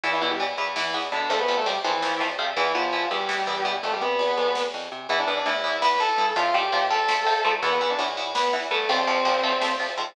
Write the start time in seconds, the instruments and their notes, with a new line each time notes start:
0.03 electric bass (finger) E2, distortion guitar E3 E4, overdriven guitar E3 B3, kick, ride
0.13 distortion guitar E3 E4
0.21 electric bass (finger) B2, overdriven guitar E3 B3, distortion guitar E3 E4
0.31 distortion guitar G3 G4
0.40 overdriven guitar E3 B3, ride
0.58 electric bass (finger) E2, overdriven guitar E3 B3
0.76 overdriven guitar E3 B3, distortion guitar E3 E4, snare
0.94 electric bass (finger) E2, overdriven guitar E3 B3
1.03 ride
1.12 electric bass (finger) B2, distortion guitar D3 D4, overdriven guitar E3 B3
1.30 electric bass (finger) F2, overdriven guitar F3 A3 C4, distortion guitar A3 A4, kick, ride
1.39 distortion guitar B3 B4
1.48 electric bass (finger) C3, overdriven guitar F3 A3 C4
1.57 distortion guitar A3 A4
1.66 overdriven guitar F3 A3 C4, distortion guitar G3 G4, ride
1.84 electric bass (finger) F2, distortion guitar E3 E4, overdriven guitar F3 A3 C4
2.02 overdriven guitar F3 A3 C4, snare
2.20 electric bass (finger) F2, overdriven guitar F3 A3 C4
2.30 ride
2.38 electric bass (finger) C3, overdriven guitar F3 A3 C4
2.57 electric bass (finger) E2, overdriven guitar E3 B3, distortion guitar E3 E4, kick, ride
2.75 electric bass (finger) B2, overdriven guitar E3 B3, distortion guitar F3 F4
2.93 overdriven guitar E3 B3, ride
3.11 electric bass (finger) E2, overdriven guitar E3 B3, distortion guitar G3 G4
3.29 overdriven guitar E3 B3, snare
3.47 electric bass (finger) E2, overdriven guitar E3 B3
3.56 ride
3.65 electric bass (finger) B2, overdriven guitar E3 B3
3.83 electric bass (finger) F2, distortion guitar A3 A4, kick, ride
3.92 distortion guitar G3 G4
4.01 electric bass (finger) C3, distortion guitar B3 B4
4.19 ride
4.37 electric bass (finger) F2
4.55 snare
4.74 electric bass (finger) F2
4.83 ride
4.92 electric bass (finger) C3
5.09 electric bass (finger) E2, overdriven guitar E3 B3, distortion guitar E4 E5, kick, ride
5.19 distortion guitar D4 D5
5.27 electric bass (finger) E2, overdriven guitar E3 B3
5.37 distortion guitar D4 D5
5.46 electric bass (finger) A2, overdriven guitar E3 B3, distortion guitar E4 E5, ride
5.64 overdriven guitar E3 B3
5.82 overdriven guitar E3 B3, distortion guitar B4 B5, snare
6.00 overdriven guitar E3 B3, distortion guitar A4 A5
6.09 ride
6.18 electric bass (finger) G2, overdriven guitar E3 B3
6.36 electric bass (finger) F2, overdriven guitar F3 A3 C4, distortion guitar F4 F5, kick, ride
6.54 electric bass (finger) F2, overdriven guitar F3 A3 C4, distortion guitar G4 G5
6.72 electric bass (finger) A#2, overdriven guitar F3 A3 C4, ride
6.90 overdriven guitar F3 A3 C4, distortion guitar A4 A5
7.08 overdriven guitar F3 A3 C4, snare
7.26 overdriven guitar F3 A3 C4
7.35 ride
7.45 electric bass (finger) G#2, overdriven guitar F3 A3 C4
7.63 electric bass (finger) E2, overdriven guitar E3 B3, distortion guitar B3 B4, kick, ride
7.72 distortion guitar B3 B4
7.81 electric bass (finger) E2, overdriven guitar E3 B3, distortion guitar B3 B4
7.90 distortion guitar D4 D5
7.99 electric bass (finger) A2, overdriven guitar E3 B3, ride
8.17 overdriven guitar E3 B3
8.35 overdriven guitar E3 B3, distortion guitar B3 B4, snare
8.53 overdriven guitar E3 B3
8.62 ride
8.71 electric bass (finger) G2, overdriven guitar E3 B3, distortion guitar A3 A4
8.89 electric bass (finger) F2, overdriven guitar F3 A3 C4, distortion guitar C4 C5, kick, ride
8.98 distortion guitar C4 C5
9.07 electric bass (finger) F2, overdriven guitar F3 A3 C4
9.25 electric bass (finger) A#2, overdriven guitar F3 A3 C4, ride
9.43 overdriven guitar F3 A3 C4
9.62 overdriven guitar F3 A3 C4, snare
9.80 overdriven guitar F3 A3 C4
9.88 ride
9.97 electric bass (finger) G#2, overdriven guitar F3 A3 C4